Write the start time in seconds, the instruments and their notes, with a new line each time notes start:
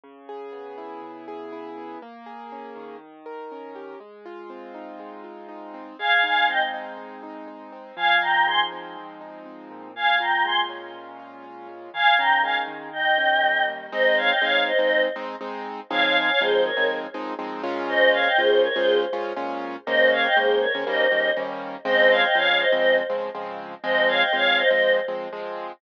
0.04 acoustic grand piano C#3
0.29 acoustic grand piano G#4
0.52 acoustic grand piano B3
0.78 acoustic grand piano E4
1.02 acoustic grand piano C#3
1.28 acoustic grand piano G#4
1.52 acoustic grand piano E4
1.78 acoustic grand piano B3
2.02 acoustic grand piano A#3
2.26 acoustic grand piano G#4
2.52 acoustic grand piano C#4
2.76 acoustic grand piano D#3
3.26 acoustic grand piano A#4
3.52 acoustic grand piano C#4
3.75 acoustic grand piano G4
4.00 acoustic grand piano G#3
4.25 acoustic grand piano F4
4.50 acoustic grand piano C4
4.74 acoustic grand piano D#4
4.99 acoustic grand piano G#3
5.24 acoustic grand piano F4
5.49 acoustic grand piano D#4
5.74 acoustic grand piano C4
5.99 acoustic grand piano G#3, choir aahs F5 G#5
6.23 acoustic grand piano D#4, choir aahs F5 G#5
6.49 acoustic grand piano C4, choir aahs D#5 G5
6.74 acoustic grand piano D#4
6.98 acoustic grand piano G#3
7.23 acoustic grand piano D#4
7.48 acoustic grand piano D#4
7.72 acoustic grand piano C4
7.96 acoustic grand piano F3, choir aahs F5 G#5
8.21 acoustic grand piano D#4, choir aahs G5 A#5
8.46 acoustic grand piano G#3, choir aahs G#5 C6
8.72 acoustic grand piano C4
8.97 acoustic grand piano F3
9.21 acoustic grand piano D#4
9.46 acoustic grand piano C4
9.71 acoustic grand piano A#2
9.96 choir aahs F5 G#5
10.20 acoustic grand piano F4, choir aahs G5 A#5
10.45 acoustic grand piano G#3, choir aahs G#5 C6
10.69 acoustic grand piano C#4
10.94 acoustic grand piano A#2
11.20 acoustic grand piano F4
11.44 acoustic grand piano C#4
11.68 acoustic grand piano G#3
11.94 acoustic grand piano D#3, choir aahs F5 G#5
12.18 acoustic grand piano C#4, choir aahs G5 A#5
12.43 acoustic grand piano G#3, choir aahs F5 G#5
12.67 acoustic grand piano D#3
12.93 choir aahs D#5 G5
13.18 acoustic grand piano C#4
13.43 acoustic grand piano G3
13.68 acoustic grand piano A#3
13.92 acoustic grand piano G#3 C4 D#4, choir aahs C5 D#5
14.17 choir aahs C#5 F5
14.30 choir aahs D#5 G5
14.41 acoustic grand piano G#3 C4 D#4, choir aahs C#5 F5
14.67 choir aahs C5 D#5
14.79 acoustic grand piano G#3 C4 D#4, choir aahs C5 D#5
15.16 acoustic grand piano G#3 C4 D#4
15.41 acoustic grand piano G#3 C4 D#4
15.90 acoustic grand piano F3 G#3 C4 D#4, choir aahs C#5 F5
16.03 choir aahs C#5 F5
16.15 choir aahs F5 G#5
16.28 choir aahs C#5 F5
16.40 acoustic grand piano F3 G#3 C4 D#4, choir aahs G#4 C5
16.65 choir aahs A#4 C#5
16.77 acoustic grand piano F3 G#3 C4 D#4
17.14 acoustic grand piano F3 G#3 C4 D#4
17.39 acoustic grand piano F3 G#3 C4 D#4
17.63 acoustic grand piano A#2 G#3 C#4 F4
17.89 choir aahs C5 D#5
18.13 choir aahs C#5 F5
18.26 choir aahs D#5 G5
18.38 acoustic grand piano A#2 G#3 C#4 F4, choir aahs G#4 C5
18.63 choir aahs A#4 C#5
18.75 acoustic grand piano A#2 G#3 C#4 F4, choir aahs G#4 C5
19.13 acoustic grand piano A#2 G#3 C#4 F4
19.36 acoustic grand piano A#2 G#3 C#4 F4
19.86 acoustic grand piano D#3 G#3 A#3 C#4, choir aahs C5 D#5
20.12 choir aahs C#5 F5
20.24 choir aahs D#5 G5
20.36 acoustic grand piano D#3 G#3 A#3 C#4, choir aahs G#4 C5
20.61 choir aahs A#4 C#5
20.75 acoustic grand piano D#3 G#3 A#3 C#4
20.87 acoustic grand piano D#3 G3 A#3 C#4, choir aahs C5 D#5
21.11 acoustic grand piano D#3 G3 A#3 C#4
21.37 acoustic grand piano D#3 G3 A#3 C#4
21.85 acoustic grand piano C#3 F3 G#3 C4, choir aahs C5 D#5
22.10 choir aahs C#5 F5
22.23 choir aahs D#5 G5
22.35 acoustic grand piano C#3 F3 G#3 C4, choir aahs C#5 F5
22.59 choir aahs C5 D#5
22.72 acoustic grand piano C#3 F3 G#3 C4, choir aahs C5 D#5
23.10 acoustic grand piano C#3 F3 G#3 C4
23.35 acoustic grand piano C#3 F3 G#3 C4
23.84 acoustic grand piano F3 G#3 C4, choir aahs C5 D#5
24.08 choir aahs C#5 F5
24.20 choir aahs D#5 G5
24.33 acoustic grand piano F3 G#3 C4, choir aahs C#5 F5
24.58 choir aahs C5 D#5
24.70 acoustic grand piano F3 G#3 C4, choir aahs C5 D#5
25.08 acoustic grand piano F3 G#3 C4
25.33 acoustic grand piano F3 G#3 C4